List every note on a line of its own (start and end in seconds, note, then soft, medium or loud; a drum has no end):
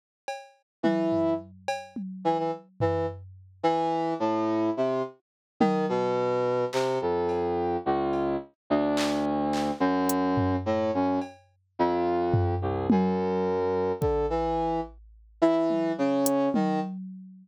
0.28 cowbell medium
0.83 1.34 E3 medium
0.83 high tom medium
1.12 floor tom medium
1.68 cowbell loud
1.96 high tom medium
2.25 2.37 E3 medium
2.38 2.51 E3 medium
2.80 3.06 E3 medium
2.80 floor tom medium
3.63 4.14 E3 medium
4.20 4.70 A2 medium
4.77 5.02 C3 medium
5.60 5.86 D#3 loud
5.60 high tom loud
5.89 6.65 B2 loud
6.73 6.99 C3 medium
6.73 clap medium
7.01 7.77 F2 medium
7.29 cowbell medium
7.86 8.36 C#2 medium
8.13 cowbell soft
8.70 9.71 D2 medium
8.97 clap medium
9.53 clap medium
9.80 10.56 F#2 loud
10.09 closed hi-hat loud
10.37 floor tom medium
10.66 10.91 A2 medium
10.94 11.19 F#2 medium
11.21 cowbell medium
11.79 12.55 F2 medium
12.34 floor tom loud
12.62 12.87 C2 medium
12.90 13.92 F#2 medium
12.90 high tom loud
14.01 14.26 D3 medium
14.01 kick medium
14.30 14.80 E3 medium
15.42 15.92 E3 loud
15.70 high tom medium
15.98 16.49 C#3 loud
16.26 closed hi-hat loud
16.54 16.80 D#3 loud
16.54 high tom loud